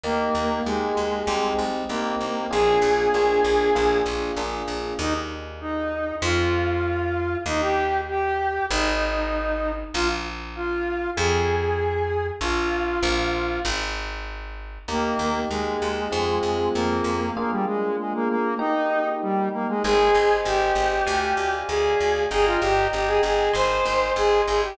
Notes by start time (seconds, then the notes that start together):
0.03 D#2 A#3 D#4 G4
0.35 D#2
0.65 D#2 G#3 A#3 D#4 G4
0.97 D#2
1.27 C2 C4 D#4 G4
1.59 C2
1.89 C2 A#3 C4 D#4 G4
2.20 C2
2.51 A#1 A#3 D4 F4 G#4
2.82 A#1
3.14 A#1 A#3 D4 F4 G#4
3.44 A#1
3.75 A#1 A#3 D4 F4 G#4
4.06 A#1
4.36 A#1 A#3 D4 F4 G#4
4.68 A#1
4.99 D#2 D#4
5.61 D#4
6.22 F2 F4
7.46 D#2 D#4
7.61 G4
8.09 G4
8.70 G#1 D#4
9.94 A#1 F4
10.55 F4
11.16 F2 G#4
12.41 A#1 F4
13.03 A#1
13.65 G#1
14.88 D#2 A#3 D#4 G4
15.19 D#2
15.49 D#2 G#3
15.82 D#2
16.12 F2 C4 F4 G#4
16.43 F2
16.74 F2 A#3
17.04 F2
17.36 A#3 D4 F4 G#4
17.51 G3
17.66 G#3
17.99 G#3
18.14 A#3
18.29 A#3
18.58 A#3 D#4 G4
19.22 G3
19.53 A#3
19.68 G#3
19.83 G#1 G#4 C5 D#5 G#5
20.14 G#1
20.45 G#1 G4
20.75 G#1
21.06 D2 D5 F5 G#5
21.37 D2
21.68 D2 G#4
22.00 D2
22.31 G1 G#4 D#5 G5 A#5
22.46 F4
22.61 G1 G4
22.93 G1 G4
23.07 G#4
23.23 G1 G#4
23.53 G#1 C5 D#5 G#5 C6
23.85 G#1
24.16 G#1 G#4
24.47 G#1 G#4
24.63 G4